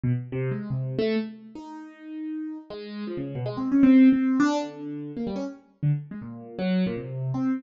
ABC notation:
X:1
M:4/4
L:1/16
Q:1/4=158
K:none
V:1 name="Acoustic Grand Piano"
B,, z2 C,2 _A,2 C,3 =A,2 z4 | _E12 _A,4 | F, _D,2 B,, (3_A,2 C2 _D2 C3 C3 =D2 | D,6 _B, G, _D z4 =D, z2 |
_A, _B,,4 _G,3 B,, C,4 C3 |]